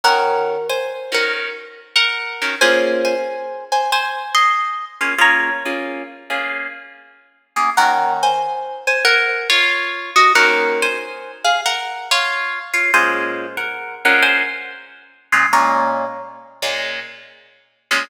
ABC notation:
X:1
M:4/4
L:1/8
Q:"Swing" 1/4=93
K:Bbm
V:1 name="Acoustic Guitar (steel)"
[Bg]2 [ca] [Bg] z2 [Bg]2 | [ca] [ca]2 [ca] [ca] [ec']2 z | [db]4 z4 | [Bg] [ca]2 [ca] [Bg] [Fd]2 [Ge] |
[Bg] [ca]2 [Af] [Bg] [Fd]2 [Fd] | [ca]2 [Bg] [Bg] [ca]2 z2 | [db]3 z5 |]
V:2 name="Acoustic Guitar (steel)"
[E,DG]3 [E,DG]4 [E,DGB] | [B,DFA]7 [B,DFA] | [B,DFA] [B,DFA]2 [B,DFA]4 [B,DFA] | [E,B,DG]8 |
[E,B,DG]8 | [B,,A,DF]3 [B,,A,DF]4 [B,,A,DF] | [B,,A,DF]3 [B,,A,DF]4 [B,,A,DF] |]